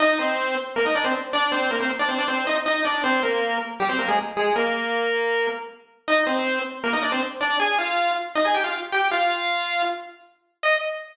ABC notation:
X:1
M:4/4
L:1/16
Q:1/4=158
K:Eb
V:1 name="Lead 1 (square)"
[Ee]2 [Cc]4 z2 [B,B] [Ee] [Dd] [Cc] z2 [Dd]2 | [Cc]2 [B,B] [Cc] z [Dd] [Cc] [Dd] [Cc]2 [Ee] z [Ee]2 [Dd]2 | [Cc]2 [B,B]4 z2 [G,G] [Cc] [B,B] [A,A] z2 [A,A]2 | [B,B]10 z6 |
[Ee]2 [Cc]4 z2 [B,B] [Ee] [Dd] [Cc] z2 [Dd]2 | [Aa]2 [Ff]4 z2 [Ee] [Aa] [Gg] [Ff] z2 [Gg]2 | [Ff]8 z8 | e4 z12 |]